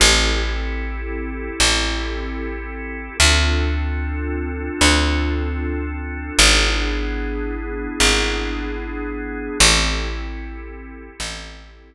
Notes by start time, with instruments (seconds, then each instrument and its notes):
0.00 electric bass (finger) A1, drawbar organ C4 E4 G4 A4
1.60 electric bass (finger) A1
3.20 electric bass (finger) D2, drawbar organ C4 D4 F4 A4
4.81 electric bass (finger) D2
6.39 electric bass (finger) G#1, drawbar organ B3 D4 E4 G#4
8.00 electric bass (finger) G#1
9.59 electric bass (finger) A1, drawbar organ C4 E4 G4 A4
11.20 electric bass (finger) A1